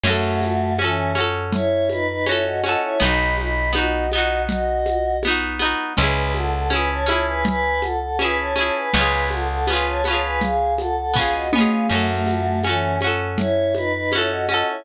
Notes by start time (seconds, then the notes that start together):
0.04 F#2 A3 C#4 F#4, crash, low conga, shaker
0.09 A4
0.41 high conga, shaker
0.78 E3 C#4 F#4, high conga, shaker
0.84 A4
1.15 C#4 F#4, high conga, shaker
1.20 A4
1.52 E4 C#5, low conga, shaker
1.89 D#4 B4, high conga, shaker
2.07 D#4 B4
2.26 C#4 E4 F#4 C#5, high conga, shaker
2.31 A4
2.45 F#4 D#5
2.63 C#4 F#4 D#5, high conga, shaker
2.69 A4
2.82 E4 C#5
3.00 B1 B3 D#4 D#5 B5, low conga, shaker
3.05 F#4
3.37 D#5 B5, high conga, shaker
3.73 B3 D#4 F#4 D#5, high conga, shaker
3.78 F#4
4.12 B3 D#4 F#4 D#5, high conga, shaker
4.18 F#4
4.48 F#4 D#5, low conga, shaker
4.86 high conga, shaker
5.23 B3, high conga, shaker
5.27 D#4 F#4
5.59 B3 D#4, high conga, shaker
5.65 F#4
5.97 C#2 C#4 E4 B4 G#5, low conga, shaker
6.03 G#4
6.34 A4 F#5, high conga, shaker
6.53 A4 F#5
6.70 C#4 E4 B4 G#5, high conga, shaker
6.75 G#4
6.90 C#5 A5
7.06 C#4 E4 C#5 A5, high conga, shaker
7.11 G#4
7.27 B4 G#5
7.45 B4 G#5, low conga, shaker
7.81 A4 F#5, high conga, shaker
8.01 A4 F#5
8.19 C#4 E4 B4 G#5, high conga, shaker
8.24 G#4
8.37 C#5 A5
8.56 C#4 E4 C#5 A5, high conga, shaker
8.61 G#4
8.75 B4 G#5
8.93 C#2 B3 C#4 B4 G#5, low conga, shaker
8.99 F4 G#4
9.30 A4 F#5, high conga, shaker
9.48 A4 F#5
9.67 B3 C#4 B4 G#5, high conga, shaker
9.73 F4 G#4
9.86 C#5 A5
10.04 B3 C#4 C#5 A5, high conga, shaker
10.10 F4 G#4
10.23 B4 G#5
10.41 G#4 F5, low conga, shaker
10.78 A4 F#5, high conga, shaker
10.97 A4 F#5
11.14 B3 C#4 G#4 F5, kick, snare
11.19 F4 G#4
11.33 F#4 D#5
11.52 B3 C#4 F#4 D#5, mid tom
11.58 F4 G#4
11.70 G#4 F5
11.90 F#2 A3 C#4 F#4, crash, low conga, shaker
11.94 A4
12.26 high conga, shaker
12.63 E3 C#4 F#4, high conga, shaker
12.69 A4
13.01 C#4 F#4, high conga, shaker
13.07 A4
13.37 E4 C#5, low conga, shaker
13.75 D#4 B4, high conga, shaker
13.94 D#4 B4
14.12 C#4 E4 F#4 C#5, high conga, shaker
14.18 A4
14.30 F#4 D#5
14.49 C#4 F#4 D#5, high conga, shaker
14.54 A4
14.67 E4 C#5